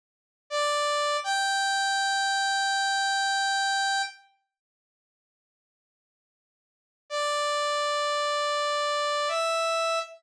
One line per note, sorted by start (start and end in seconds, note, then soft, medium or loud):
0.50 1.17 D5 medium
1.24 4.02 G5 medium
7.10 9.29 D5 medium
9.28 9.99 E5 medium